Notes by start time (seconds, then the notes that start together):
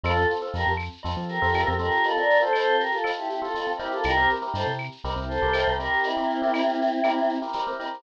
0.03 F2 C4 F4 A4, cowbell, claves, shaker
0.16 C4 F4 A4, shaker
0.30 shaker
0.41 C4 F4 A4, shaker
0.54 F2 G4 A#4, tambourine, cowbell, shaker
0.67 F2, shaker
0.77 claves, shaker
0.92 shaker
1.03 F2 C4 F4 A4, cowbell, shaker
1.17 F3, shaker
1.28 G4 A#4, shaker
1.42 F2 C4 F4 A4, shaker
1.53 C4 F4 A4, tambourine, cowbell, claves, shaker
1.66 F2 C4 F4 A4, shaker
1.78 C4 F4 G4 A4 A#4, cowbell, shaker
1.91 shaker
2.03 F4 A4, cowbell, shaker
2.17 C4 F4 A4 A#4 D5, shaker
2.30 shaker
2.40 C4 F4 A4 C5, shaker
2.53 A4 C5, tambourine, cowbell, claves, shaker
2.68 shaker
2.79 G4 A#4, shaker
2.91 F4 A4, shaker
3.04 C4 F4 A4, cowbell, claves, shaker
3.17 E4 G4, shaker
3.28 E4 G4, shaker
3.42 C4 F4 A4, shaker
3.54 C4 F4 A4, tambourine, cowbell, shaker
3.66 C4 F4 A4, shaker
3.78 C4 E4 G4 A#4, cowbell, shaker
3.91 F4 A4, shaker
4.03 C2 G4 A#4, cowbell, claves, shaker
4.17 C4 E4 G4 A#4, shaker
4.29 shaker
4.41 C4 E4 G4 A#4, shaker
4.54 G2 A4 C5, tambourine, cowbell, shaker
4.67 C3, shaker
4.78 claves, shaker
4.91 shaker
5.04 C2 C4 E4 G4 A#4, cowbell, shaker
5.16 C2, shaker
5.28 A4 C5, shaker
5.42 C2 C4 E4 G4 A#4, shaker
5.53 C4 E4 G4 A#4, tambourine, cowbell, claves, shaker
5.67 C2 C4 E4 G4 A#4, shaker
5.79 C4 E4 G4 A#4, cowbell, shaker
5.93 shaker
6.03 C4 E4, cowbell, shaker
6.17 C4 E4 G4 A#4, shaker
6.30 shaker
6.42 C4 E4 G4 A#4, shaker
6.53 tambourine, cowbell, claves, shaker
6.69 shaker
6.81 shaker
6.91 shaker
7.04 C4 E4 G4 A#4, cowbell, claves, shaker
7.18 shaker
7.29 shaker
7.42 C4 E4 G4 A#4, shaker
7.53 C4 E4 G4 A#4, tambourine, cowbell, shaker
7.67 C4 E4 G4 A#4, shaker
7.79 C4 E4 G4 A#4, cowbell, shaker
7.94 shaker